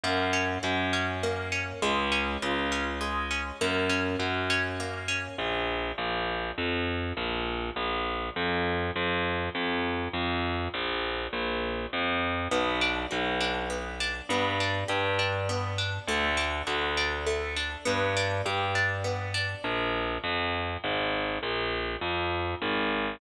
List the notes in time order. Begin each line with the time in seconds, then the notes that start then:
0.03 F#2 A#3
0.33 C#4
0.63 F#2 F#4
0.93 C#4
1.23 A#3
1.52 C#4
1.82 C#2 G#3
2.12 C#4
2.42 C#2 F4
2.72 C#4
3.01 G#3
3.31 C#4
3.61 F#2 A#3
3.89 C#4
4.19 F#2 F#4
4.50 C#4
4.80 A#3
5.08 C#4
5.38 A#1
5.98 A#1
6.58 F2
7.17 A#1
7.76 A#1
8.36 F2
8.96 F2
9.55 F2
10.13 F2
10.74 A#1
11.33 A#1
11.93 F2
12.51 B1 B3
12.81 D4
13.11 B1 F#4
13.41 D4
13.70 B3
14.00 D4
14.29 G2 B3
14.60 D4
14.88 G2 G4
15.19 D4
15.49 B3
15.78 D4
16.07 D2 A3
16.37 D4
16.67 D2 F#4
16.97 D4
17.26 A3
17.56 D4
17.85 G2 B3
18.17 D4
18.46 G2 G4
18.75 D4
19.04 B3
19.34 D4
19.64 A#1
20.24 F2
20.84 G#1
21.43 A#1
22.01 F2
22.62 G#1